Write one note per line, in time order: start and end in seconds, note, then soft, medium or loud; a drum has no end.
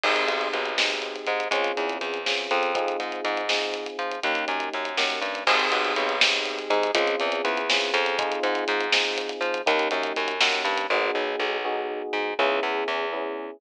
0.03 0.25 G#1 medium
0.03 0.70 C4 medium
0.03 0.70 D#4 medium
0.03 0.70 G4 medium
0.03 0.70 G#4 medium
0.03 kick medium
0.03 crash medium
0.16 closed hi-hat medium
0.27 0.48 B1 medium
0.27 closed hi-hat medium
0.41 closed hi-hat medium
0.53 1.16 B1 medium
0.53 closed hi-hat medium
0.66 closed hi-hat medium
0.78 1.44 C4 medium
0.78 1.44 D#4 medium
0.78 1.44 G4 medium
0.78 1.44 G#4 medium
0.78 snare medium
0.90 closed hi-hat medium
1.02 closed hi-hat medium
1.16 closed hi-hat medium
1.27 1.48 G#2 medium
1.27 closed hi-hat medium
1.40 closed hi-hat medium
1.51 1.72 C#2 loud
1.51 2.19 C4 medium
1.51 2.19 C#4 medium
1.51 2.19 F4 medium
1.51 2.19 G#4 medium
1.51 kick medium
1.51 closed hi-hat medium
1.64 closed hi-hat medium
1.77 1.98 E2 medium
1.77 closed hi-hat medium
1.90 closed hi-hat medium
2.01 2.48 E2 medium
2.01 closed hi-hat medium
2.14 closed hi-hat medium
2.26 2.70 C4 medium
2.26 2.70 C#4 medium
2.26 2.70 F4 medium
2.26 2.70 G#4 medium
2.26 snare medium
2.38 closed hi-hat medium
2.51 2.97 F2 loud
2.51 closed hi-hat medium
2.63 closed hi-hat medium
2.75 3.42 C4 medium
2.75 3.42 D#4 medium
2.75 3.42 F4 medium
2.75 3.42 G#4 medium
2.75 kick medium
2.75 closed hi-hat medium
2.88 closed hi-hat medium
3.00 3.21 G#2 medium
3.00 closed hi-hat medium
3.12 closed hi-hat medium
3.25 3.88 G#2 loud
3.25 closed hi-hat medium
3.37 closed hi-hat medium
3.49 4.16 C4 medium
3.49 4.16 D#4 medium
3.49 4.16 F4 medium
3.49 4.16 G#4 medium
3.49 snare medium
3.62 closed hi-hat medium
3.74 closed hi-hat medium
3.86 closed hi-hat medium
3.99 4.20 F3 medium
3.99 closed hi-hat medium
4.12 closed hi-hat medium
4.23 4.45 D#2 loud
4.23 4.90 A#3 medium
4.23 4.90 C#4 medium
4.23 4.90 D#4 loud
4.23 4.90 G4 medium
4.23 kick medium
4.23 closed hi-hat medium
4.35 closed hi-hat medium
4.48 4.69 F#2 medium
4.48 closed hi-hat medium
4.60 closed hi-hat medium
4.73 4.97 F#2 medium
4.73 closed hi-hat medium
4.85 closed hi-hat medium
4.98 5.20 F#2 medium
4.98 5.43 A#3 medium
4.98 5.43 C#4 medium
4.98 5.43 D#4 medium
4.98 5.43 G4 medium
4.98 snare medium
5.10 closed hi-hat medium
5.22 5.44 G2 medium
5.22 closed hi-hat medium
5.35 closed hi-hat medium
5.47 5.68 G#1 loud
5.47 6.14 C4 loud
5.47 6.14 D#4 medium
5.47 6.14 G4 medium
5.47 6.14 G#4 medium
5.47 kick loud
5.47 crash loud
5.59 closed hi-hat medium
5.72 5.93 B1 loud
5.72 closed hi-hat medium
5.85 closed hi-hat medium
5.96 6.59 B1 loud
5.96 closed hi-hat medium
6.09 closed hi-hat medium
6.21 6.88 C4 medium
6.21 6.88 D#4 medium
6.21 6.88 G4 medium
6.21 6.88 G#4 medium
6.21 snare loud
6.33 closed hi-hat medium
6.45 closed hi-hat medium
6.59 closed hi-hat medium
6.70 6.91 G#2 loud
6.70 closed hi-hat medium
6.83 closed hi-hat medium
6.95 7.16 C#2 loud
6.95 7.61 C4 loud
6.95 7.61 C#4 loud
6.95 7.61 F4 loud
6.95 7.61 G#4 medium
6.95 kick medium
6.95 closed hi-hat loud
7.07 closed hi-hat medium
7.20 7.42 E2 loud
7.20 closed hi-hat medium
7.32 closed hi-hat medium
7.45 7.91 E2 loud
7.45 closed hi-hat medium
7.57 closed hi-hat medium
7.70 8.14 C4 medium
7.70 8.14 C#4 medium
7.70 8.14 F4 medium
7.70 8.14 G#4 medium
7.70 snare loud
7.81 closed hi-hat medium
7.94 8.39 F2 loud
7.94 closed hi-hat medium
8.06 closed hi-hat medium
8.19 8.86 C4 medium
8.19 8.86 D#4 loud
8.19 8.86 F4 loud
8.19 8.86 G#4 loud
8.19 kick loud
8.19 closed hi-hat medium
8.32 closed hi-hat medium
8.43 8.64 G#2 loud
8.43 closed hi-hat medium
8.55 closed hi-hat medium
8.68 9.31 G#2 loud
8.68 closed hi-hat medium
8.81 closed hi-hat medium
8.92 9.59 C4 medium
8.92 9.59 D#4 medium
8.92 9.59 F4 medium
8.92 9.59 G#4 medium
8.92 snare loud
9.05 closed hi-hat medium
9.18 closed hi-hat medium
9.29 closed hi-hat medium
9.41 9.62 F3 loud
9.41 closed hi-hat medium
9.54 closed hi-hat medium
9.66 9.88 D#2 loud
9.66 10.33 A#3 medium
9.66 10.33 C#4 medium
9.66 10.33 D#4 loud
9.66 10.33 G4 medium
9.66 kick loud
9.66 closed hi-hat medium
9.79 closed hi-hat medium
9.91 10.13 F#2 loud
9.91 closed hi-hat medium
10.03 closed hi-hat medium
10.16 10.40 F#2 loud
10.16 closed hi-hat medium
10.28 closed hi-hat medium
10.41 10.63 F#2 loud
10.41 10.85 A#3 medium
10.41 10.85 C#4 medium
10.41 10.85 D#4 medium
10.41 10.85 G4 medium
10.41 snare loud
10.53 closed hi-hat medium
10.65 10.87 G2 loud
10.65 closed hi-hat medium
10.78 closed hi-hat medium
10.90 11.11 G#1 loud
10.90 11.57 B3 loud
10.90 11.57 D#4 medium
10.90 11.57 F#4 medium
10.90 11.57 G#4 loud
11.15 11.36 B1 medium
11.40 12.02 B1 loud
11.65 12.32 B3 medium
11.65 12.32 D#4 medium
11.65 12.32 F#4 loud
11.65 12.32 G#4 medium
12.13 12.34 G#2 medium
12.39 12.60 C#2 loud
12.39 13.05 B3 loud
12.39 13.05 C#4 medium
12.39 13.05 E4 loud
12.39 13.05 G#4 loud
12.63 12.84 E2 loud
12.88 13.51 E2 loud
13.13 13.57 B3 medium
13.13 13.57 C#4 medium
13.13 13.57 E4 medium
13.13 13.57 G#4 medium